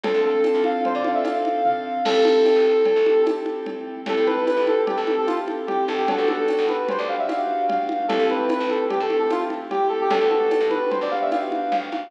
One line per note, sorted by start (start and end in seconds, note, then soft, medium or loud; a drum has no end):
0.03 0.13 D2 loud
0.03 0.97 C4 medium
0.03 0.97 D4 medium
0.03 0.97 F4 medium
0.03 0.20 A4 medium
0.03 0.97 A4 medium
0.03 cowbell loud
0.03 low conga loud
0.14 0.32 D2 medium
0.25 0.63 A4 medium
0.44 tambourine medium
0.44 cowbell medium
0.44 high conga medium
0.55 0.73 D2 medium
0.64 0.81 F5 medium
0.64 high conga medium
0.85 0.95 C5 medium
0.85 cowbell medium
0.85 low conga medium
0.95 1.13 D3 medium
0.95 1.04 D5 medium
1.04 1.23 C4 medium
1.04 1.23 D4 medium
1.04 1.23 F4 medium
1.04 1.23 A4 medium
1.04 1.15 F5 medium
1.04 high conga medium
1.14 1.24 E5 medium
1.24 1.99 C4 medium
1.24 1.99 D4 medium
1.24 1.99 F4 medium
1.24 1.99 A4 medium
1.24 1.62 F5 medium
1.24 tambourine medium
1.24 cowbell medium
1.24 high conga medium
1.45 high conga medium
1.65 2.01 F5 medium
1.65 kick medium
1.65 floor tom medium
2.05 2.14 A1 loud
2.05 2.98 C4 medium
2.05 2.98 E4 medium
2.05 2.98 G4 medium
2.05 3.21 A4 medium
2.05 2.98 A4 medium
2.05 crash loud
2.05 cowbell loud
2.05 low conga loud
2.15 2.33 A1 medium
2.25 high conga loud
2.45 tambourine medium
2.45 cowbell medium
2.45 high conga medium
2.56 2.74 A1 medium
2.85 cowbell medium
2.85 low conga medium
2.96 3.14 A1 medium
3.06 3.25 C4 medium
3.06 3.25 E4 medium
3.06 3.25 G4 medium
3.06 3.25 A4 medium
3.06 high conga medium
3.26 4.00 C4 medium
3.26 4.00 E4 medium
3.26 4.00 G4 medium
3.26 4.00 A4 medium
3.26 tambourine medium
3.26 cowbell medium
3.26 high conga loud
3.46 high conga medium
3.66 cowbell medium
3.66 low conga medium
4.06 4.15 A1 loud
4.06 4.99 C4 medium
4.06 4.99 E4 medium
4.06 4.99 G4 medium
4.06 4.99 A4 medium
4.06 4.26 A4 medium
4.06 cowbell loud
4.06 low conga loud
4.17 4.35 A2 medium
4.26 4.44 B4 medium
4.26 high conga medium
4.47 4.65 B4 medium
4.47 tambourine medium
4.47 cowbell medium
4.47 high conga medium
4.57 4.75 A1 medium
4.67 4.77 A4 medium
4.67 high conga medium
4.86 4.96 G4 medium
4.86 cowbell medium
4.86 low conga loud
4.96 5.16 A1 medium
4.96 5.15 A4 medium
5.07 5.26 C4 medium
5.07 5.26 E4 medium
5.07 5.26 G4 medium
5.07 5.26 A4 medium
5.07 high conga medium
5.18 5.27 A4 medium
5.27 6.02 C4 medium
5.27 6.02 E4 medium
5.27 5.36 F4 medium
5.27 6.02 G4 medium
5.27 6.02 A4 medium
5.27 tambourine medium
5.27 high conga medium
5.48 high conga medium
5.67 5.84 G4 medium
5.67 cowbell medium
5.67 low conga medium
5.88 6.18 G1 loud
5.88 5.98 A4 medium
5.88 high conga medium
5.98 6.07 G4 medium
6.08 7.01 B3 medium
6.08 7.01 D4 medium
6.08 7.01 F#4 loud
6.08 7.01 G4 medium
6.08 6.28 A4 medium
6.08 cowbell loud
6.08 low conga loud
6.18 6.36 G1 medium
6.28 6.65 A4 medium
6.28 high conga medium
6.48 tambourine medium
6.48 cowbell medium
6.48 high conga medium
6.58 6.77 G1 loud
6.69 6.87 B4 medium
6.69 high conga medium
6.88 6.99 C5 medium
6.88 cowbell medium
6.88 low conga loud
6.98 7.17 D2 loud
6.98 7.08 D5 medium
7.08 7.27 B3 medium
7.08 7.27 D4 medium
7.08 7.27 F#4 medium
7.08 7.27 G4 medium
7.08 7.18 F5 medium
7.19 7.28 E5 medium
7.28 8.03 B3 medium
7.28 8.03 D4 medium
7.28 8.03 F#4 medium
7.28 8.03 G4 medium
7.28 7.63 F5 medium
7.28 tambourine medium
7.28 cowbell medium
7.28 high conga medium
7.69 8.03 F5 medium
7.69 cowbell medium
7.69 low conga loud
7.89 high conga medium
8.08 8.18 A1 loud
8.08 9.02 A3 medium
8.08 9.02 C4 medium
8.08 9.02 E4 medium
8.08 9.02 G4 medium
8.08 8.25 A4 medium
8.08 cowbell loud
8.08 low conga loud
8.19 8.37 A1 loud
8.30 8.49 B4 medium
8.30 high conga medium
8.49 8.69 B4 medium
8.49 tambourine medium
8.49 cowbell medium
8.49 high conga loud
8.60 8.78 A1 loud
8.70 8.80 A4 medium
8.70 high conga medium
8.89 8.99 G4 medium
8.89 cowbell medium
8.89 low conga loud
9.00 9.19 A2 medium
9.00 9.18 A4 medium
9.10 9.29 A3 medium
9.10 9.29 C4 medium
9.10 9.29 E4 medium
9.10 9.29 G4 medium
9.10 high conga medium
9.19 9.29 A4 medium
9.30 10.04 A3 medium
9.30 10.04 C4 medium
9.30 10.04 E4 medium
9.30 9.41 F4 medium
9.30 10.04 G4 medium
9.30 tambourine medium
9.30 cowbell medium
9.30 high conga medium
9.50 high conga medium
9.71 9.87 G4 medium
9.71 cowbell medium
9.71 low conga medium
9.89 9.98 A4 medium
10.01 10.11 G4 medium
10.10 10.19 G1 loud
10.10 11.04 B3 medium
10.10 11.04 D4 medium
10.10 11.04 F#4 medium
10.10 11.04 G4 medium
10.10 10.29 A4 medium
10.10 cowbell loud
10.10 low conga loud
10.21 10.39 D2 medium
10.30 10.66 A4 medium
10.30 high conga medium
10.51 tambourine medium
10.51 cowbell medium
10.51 high conga medium
10.60 10.79 G2 medium
10.70 10.89 B4 medium
10.70 high conga medium
10.90 11.00 C5 medium
10.90 cowbell medium
10.90 low conga loud
11.01 11.19 G1 medium
11.01 11.11 D5 medium
11.11 11.30 B3 medium
11.11 11.30 D4 medium
11.11 11.30 F#4 medium
11.11 11.30 G4 medium
11.11 11.20 F5 medium
11.22 11.31 E5 medium
11.31 12.06 B3 medium
11.31 12.06 D4 medium
11.31 12.06 F#4 medium
11.31 12.06 G4 medium
11.31 11.70 F5 medium
11.31 tambourine medium
11.31 cowbell medium
11.31 high conga medium
11.52 high conga medium
11.72 11.90 G1 medium
11.72 12.08 F5 medium
11.72 cowbell medium
11.72 low conga medium
11.92 12.10 G#1 medium
11.92 high conga medium